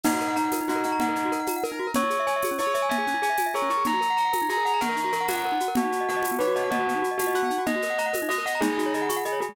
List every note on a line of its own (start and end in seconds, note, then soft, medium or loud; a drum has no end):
0.04 0.34 D#4 loud
0.04 0.12 D#4 loud
0.04 crash medium
0.04 low conga medium
0.04 shaker medium
0.12 0.20 F#4 medium
0.20 0.28 A#4 medium
0.20 shaker medium
0.28 0.35 F#5 medium
0.36 0.50 D#4 loud
0.36 0.43 A#5 loud
0.36 shaker medium
0.45 0.52 F#5 medium
0.52 0.60 A#4 medium
0.52 tambourine medium
0.52 high conga medium
0.52 shaker medium
0.61 0.68 D#4 medium
0.68 0.84 D#4 medium
0.68 0.97 F#4 medium
0.68 0.76 F#4 loud
0.68 shaker medium
0.75 0.83 A#4 medium
0.83 0.99 D#4 medium
0.83 0.91 F#5 medium
0.83 shaker medium
0.92 0.99 A#5 loud
1.00 1.30 D#4 loud
1.00 1.08 F#5 loud
1.00 low conga medium
1.00 shaker medium
1.09 1.16 A#4 medium
1.16 1.23 D#4 medium
1.16 shaker medium
1.25 1.32 F#4 medium
1.32 1.39 A#4 loud
1.32 shaker medium
1.40 1.47 F#5 medium
1.46 1.55 A#5 medium
1.46 tambourine medium
1.46 high conga medium
1.46 shaker medium
1.56 1.63 F#5 medium
1.63 1.91 A#4 medium
1.63 1.71 A#4 medium
1.63 shaker medium
1.72 1.79 D#4 medium
1.79 1.87 F#4 medium
1.87 1.94 A#4 medium
1.94 2.03 C#4 loud
1.94 2.22 C#5 loud
1.94 low conga medium
1.94 shaker medium
2.04 2.11 E4 medium
2.10 2.17 G#4 medium
2.10 shaker medium
2.20 2.27 E5 loud
2.27 2.41 C#5 loud
2.27 2.34 G#5 loud
2.27 shaker medium
2.36 2.43 E5 medium
2.42 2.50 G#4 loud
2.42 tambourine medium
2.42 high conga medium
2.42 shaker medium
2.51 2.58 C#4 medium
2.59 2.66 E4 loud
2.59 2.85 C#5 medium
2.59 2.74 C#5 medium
2.59 shaker medium
2.67 2.74 G#4 medium
2.74 2.89 C#5 loud
2.74 2.81 E5 medium
2.74 shaker medium
2.82 2.89 G#5 medium
2.89 2.97 E5 loud
2.89 3.15 G#5 loud
2.89 low conga medium
2.89 shaker medium
2.98 3.05 G#4 medium
3.07 3.14 C#4 medium
3.07 shaker medium
3.14 3.21 E4 medium
3.22 3.29 G#4 loud
3.22 3.38 G#5 loud
3.22 shaker medium
3.30 3.37 E5 medium
3.37 3.46 G#5 medium
3.37 tambourine medium
3.37 high conga medium
3.37 shaker medium
3.46 3.53 E5 medium
3.54 3.61 G#4 loud
3.54 3.83 A#4 medium
3.54 3.69 C#5 loud
3.54 shaker medium
3.62 3.69 C#4 medium
3.70 3.77 E4 medium
3.70 3.84 C#6 medium
3.70 shaker medium
3.78 3.85 G#4 medium
3.84 3.93 D#4 loud
3.84 4.13 A#5 loud
3.84 low conga medium
3.84 shaker medium
3.93 4.00 F#4 medium
4.01 4.08 A#4 medium
4.01 shaker medium
4.10 4.17 F#5 medium
4.17 4.24 A#5 medium
4.17 4.31 A#5 loud
4.17 shaker medium
4.25 4.32 F#5 medium
4.33 4.40 A#4 medium
4.33 tambourine medium
4.33 high conga medium
4.33 shaker medium
4.42 4.49 D#4 medium
4.49 4.56 F#4 medium
4.49 4.80 G#4 medium
4.49 4.65 A#5 loud
4.49 shaker medium
4.57 4.64 A#4 medium
4.65 4.72 F#5 loud
4.65 4.80 A#5 loud
4.65 shaker medium
4.74 4.81 A#5 loud
4.81 5.11 A#4 loud
4.81 5.42 A#4 medium
4.81 4.88 F#5 loud
4.81 low conga medium
4.81 shaker medium
4.89 4.96 A#4 medium
4.96 5.04 D#4 medium
4.96 shaker medium
5.04 5.11 F#4 medium
5.12 5.28 A#4 medium
5.12 5.20 A#4 medium
5.12 shaker medium
5.21 5.28 F#5 medium
5.28 5.57 F#5 loud
5.28 5.35 A#5 loud
5.28 tambourine medium
5.28 high conga medium
5.28 shaker medium
5.36 5.43 F#5 loud
5.45 5.52 A#4 medium
5.52 5.59 D#4 medium
5.60 5.68 F#4 medium
5.60 shaker medium
5.68 5.75 A#4 medium
5.75 5.84 B3 loud
5.75 6.03 F#4 loud
5.75 low conga loud
5.75 shaker medium
5.84 5.91 D#4 medium
5.92 5.99 F#4 medium
5.92 shaker medium
6.01 6.08 D#5 medium
6.09 6.24 F#4 loud
6.09 6.16 F#5 loud
6.09 shaker medium
6.16 6.24 D#5 medium
6.23 6.31 F#4 medium
6.23 tambourine medium
6.23 high conga medium
6.23 shaker medium
6.31 6.38 B3 medium
6.39 6.47 D#4 medium
6.39 6.52 B4 medium
6.39 6.70 C#5 medium
6.39 shaker medium
6.47 6.55 F#4 loud
6.55 6.70 F#4 loud
6.55 6.63 D#5 medium
6.55 shaker medium
6.64 6.71 F#5 medium
6.70 6.97 F#4 loud
6.70 6.79 D#5 loud
6.70 low conga medium
6.70 shaker medium
6.79 6.87 F#4 medium
6.87 6.94 B3 medium
6.87 shaker medium
6.95 7.02 D#4 loud
7.02 7.09 F#4 loud
7.02 shaker medium
7.11 7.18 D#5 medium
7.18 7.44 F#4 loud
7.18 7.27 F#5 medium
7.18 tambourine medium
7.18 high conga medium
7.18 shaker medium
7.27 7.34 D#5 medium
7.34 7.42 F#4 loud
7.34 7.61 F#5 medium
7.34 shaker medium
7.43 7.50 B3 medium
7.50 7.58 D#4 medium
7.50 shaker medium
7.58 7.65 F#4 loud
7.66 7.74 D#4 loud
7.66 7.95 D#5 loud
7.66 low conga medium
7.66 shaker medium
7.76 7.83 F#4 medium
7.82 7.90 A#4 medium
7.82 shaker medium
7.90 7.97 F#5 medium
7.98 8.13 D#5 medium
7.98 8.06 A#5 loud
7.98 shaker medium
8.06 8.13 F#5 medium
8.13 8.20 A#4 medium
8.13 tambourine medium
8.13 high conga medium
8.13 shaker medium
8.22 8.29 D#4 medium
8.29 8.37 F#4 medium
8.29 8.43 D#5 loud
8.29 8.59 D#5 medium
8.29 shaker medium
8.38 8.45 A#4 medium
8.46 8.61 D#5 loud
8.46 8.53 F#5 loud
8.46 shaker medium
8.55 8.62 A#5 medium
8.61 8.69 G#3 loud
8.61 9.07 D#4 medium
8.61 8.88 G#4 loud
8.61 low conga medium
8.61 shaker medium
8.70 8.77 D#4 medium
8.78 8.85 F#4 medium
8.78 shaker medium
8.86 8.93 C#5 medium
8.94 9.09 G#4 loud
8.94 9.01 D#5 medium
8.94 shaker medium
9.02 9.09 F#5 medium
9.09 9.16 C#6 medium
9.09 tambourine medium
9.09 high conga medium
9.09 shaker medium
9.16 9.24 F#5 medium
9.25 9.39 G#4 medium
9.25 9.32 D#5 loud
9.25 shaker medium
9.32 9.39 C#5 medium
9.40 9.48 F#4 medium
9.40 9.54 G#4 loud
9.40 shaker medium
9.49 9.55 G#3 medium